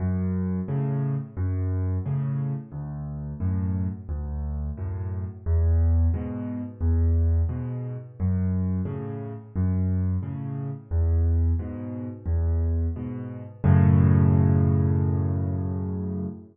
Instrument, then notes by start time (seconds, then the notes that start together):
acoustic grand piano
0.00 F#2
0.68 A2 C#3
1.37 F#2
2.06 A2 C#3
2.72 D2
3.40 F#2 A2
4.09 D2
4.77 F#2 A2
5.46 E2
6.14 G#2 B2
6.81 E2
7.49 G#2 B2
8.20 F#2
8.85 A2 C#3
9.56 F#2
10.23 A2 C#3
10.91 E2
11.59 G#2 B2
12.26 E2
12.96 G#2 B2
13.64 F#2 A2 C#3